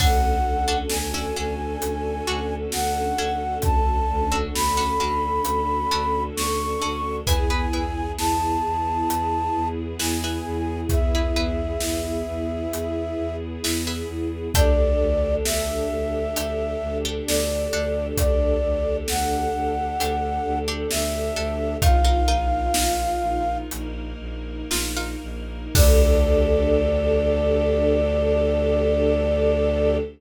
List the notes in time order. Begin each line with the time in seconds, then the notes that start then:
0.00 D2 C#4 D4 F#4 A4 F#5, kick, crash
0.45 D2
0.68 C#4 D4 F#4 A4
0.90 D2 G#5, snare
1.14 C#4 D4 F#4 A4
1.36 D2 C#4 D4 F#4 A4
1.82 D2, closed hi-hat
2.27 D2 C#4 D4 F#4 A4
2.72 D2 F#5, snare
3.18 D2 C#4 D4 F#4 A4
3.62 D2 A5, kick, closed hi-hat
4.09 D2
4.32 C#4 D4 F#4 A4
4.55 D2 B5, snare
4.77 C#4 D4 F#4 A4
5.00 D2 C#4 D4 F#4 A4
5.45 D2, closed hi-hat
5.91 D2 C#4 D4 F#4 A4
6.36 D2 C#6, snare
6.82 D2 C#4 D4 F#4 A4
7.27 E2 B3 E4 G#4 B4 G#5, kick, closed hi-hat
7.50 E4 G#4 B4
7.73 E2 E4 G#4 B4
8.18 E2 A5, snare
8.64 E2
9.09 E2, closed hi-hat
9.55 E2
9.99 E2 E4 G#4 B4 G#5, snare
10.24 E4 G#4 B4
10.46 E2
10.89 E2 E5, kick, closed hi-hat
11.15 E4 G#4 B4
11.36 E2 E4 G#4 B4
11.80 E2, snare
12.27 E2
12.73 E2, closed hi-hat
13.18 E2
13.63 E2 E4 G#4 B4, snare
13.87 E4 G#4 B4
14.09 E2
14.54 D2 D4 G4 A4 D5, kick, closed hi-hat
15.00 D2
15.45 D2 E5, snare
15.91 D2
16.36 D2 D4 G4 A4, closed hi-hat
16.82 D2
17.05 D4 G4 A4
17.27 D2 D5, snare
17.73 D2 D4 G4 A4
18.17 D2 D5, kick, closed hi-hat
18.64 D2
19.08 D2 F#5, snare
19.55 D2
20.00 D2 D4 G4 A4, closed hi-hat
20.46 D2
20.68 D4 G4 A4
20.91 D2 E5, snare
21.36 D2 D4 G4 A4
21.82 A#1 D#4 F4 A#4 F5, kick, closed hi-hat
22.05 D#4 F4 A#4
22.27 A#1 D#4 F4 A#4
22.74 A#1, snare
23.22 A#1
23.71 A#1 A#3 D#4 A#4, closed hi-hat
24.20 A#1
24.71 A#1 D#4 F4 A#4, snare
24.97 D#4 F4 A#4
25.23 A#1
25.75 D2 D4 G4 A4 D5, kick, crash